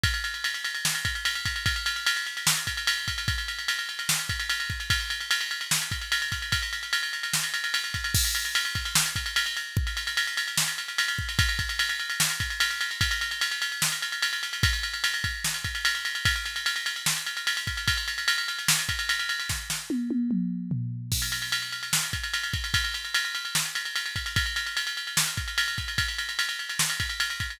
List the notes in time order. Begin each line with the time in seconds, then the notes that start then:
0.03 kick, ride
0.14 ride
0.24 ride
0.34 ride
0.44 ride
0.54 ride
0.64 ride
0.75 ride
0.85 snare
0.95 ride
1.05 kick, ride
1.15 ride
1.25 ride
1.35 ride
1.45 kick, ride
1.56 ride
1.66 kick, ride
1.76 ride
1.86 ride
1.96 ride
2.06 ride
2.16 ride
2.27 ride
2.37 ride
2.47 snare
2.57 ride
2.67 kick, ride
2.77 ride
2.87 ride
2.98 ride
3.08 kick, ride
3.18 ride
3.28 kick, ride
3.38 ride
3.48 ride
3.59 ride
3.68 ride
3.79 ride
3.89 ride
3.99 ride
4.09 snare
4.19 ride
4.29 kick, ride
4.40 ride
4.49 ride
4.60 ride
4.70 kick, ride
4.80 ride
4.90 kick, ride
5.00 ride
5.10 ride
5.20 ride
5.31 ride
5.41 ride
5.51 ride
5.61 ride
5.71 snare
5.82 ride
5.91 kick, ride
6.01 ride
6.12 ride
6.22 ride
6.32 kick, ride
6.42 ride
6.52 kick, ride
6.62 ride
6.73 ride
6.83 ride
6.93 ride
7.03 ride
7.13 ride
7.23 ride
7.33 snare
7.43 ride
7.54 ride
7.64 ride
7.74 ride
7.84 ride
7.94 kick, ride
8.04 ride
8.14 kick, crash
8.25 ride
8.35 ride
8.45 ride
8.55 ride
8.65 ride
8.75 kick, ride
8.85 ride
8.95 snare
9.06 ride
9.16 kick, ride
9.26 ride
9.36 ride
9.46 ride
9.57 ride
9.77 kick
9.87 ride
9.97 ride
10.07 ride
10.17 ride
10.27 ride
10.37 ride
10.48 ride
10.57 snare
10.68 ride
10.78 ride
10.88 ride
10.98 ride
11.08 ride
11.18 kick
11.29 ride
11.39 kick, ride
11.49 ride
11.59 kick, ride
11.69 ride
11.79 ride
11.89 ride
11.99 ride
12.10 ride
12.20 snare
12.30 ride
12.40 kick, ride
12.50 ride
12.60 ride
12.70 ride
12.81 ride
12.91 ride
13.01 kick, ride
13.11 ride
13.21 ride
13.31 ride
13.41 ride
13.51 ride
13.62 ride
13.72 ride
13.82 snare
13.92 ride
14.02 ride
14.12 ride
14.22 ride
14.33 ride
14.43 ride
14.53 ride
14.63 kick, ride
14.73 ride
14.83 ride
14.93 ride
15.04 ride
15.14 ride
15.24 kick, ride
15.44 snare
15.54 ride
15.64 kick, ride
15.75 ride
15.85 ride
15.95 ride
16.05 ride
16.15 ride
16.25 kick, ride
16.36 ride
16.46 ride
16.56 ride
16.66 ride
16.76 ride
16.86 ride
16.96 ride
17.06 snare
17.16 ride
17.26 ride
17.37 ride
17.47 ride
17.57 ride
17.67 kick, ride
17.77 ride
17.87 kick, ride
17.97 ride
18.08 ride
18.18 ride
18.28 ride
18.38 ride
18.48 ride
18.59 ride
18.68 snare
18.79 ride
18.89 kick, ride
18.99 ride
19.09 ride
19.19 ride
19.29 ride
19.40 ride
19.49 kick, snare
19.70 snare
19.90 high tom
20.10 high tom
20.31 mid tom
20.71 floor tom
21.12 kick, crash
21.22 ride
21.32 ride
21.42 ride
21.52 ride
21.62 ride
21.72 ride
21.83 ride
21.93 snare
22.03 ride
22.13 kick, ride
22.23 ride
22.34 ride
22.43 ride
22.53 kick, ride
22.64 ride
22.74 kick, ride
22.84 ride
22.94 ride
23.05 ride
23.14 ride
23.25 ride
23.35 ride
23.45 ride
23.55 snare
23.65 ride
23.75 ride
23.85 ride
23.96 ride
24.06 ride
24.16 kick, ride
24.26 ride
24.36 kick, ride
24.46 ride
24.56 ride
24.66 ride
24.77 ride
24.87 ride
24.97 ride
25.07 ride
25.17 snare
25.27 ride
25.37 kick, ride
25.48 ride
25.58 ride
25.68 ride
25.78 kick, ride
25.88 ride
25.98 kick, ride
26.08 ride
26.18 ride
26.29 ride
26.39 ride
26.49 ride
26.59 ride
26.69 ride
26.79 snare
26.90 ride
27.00 kick, ride
27.09 ride
27.20 ride
27.30 ride
27.40 kick, ride
27.50 ride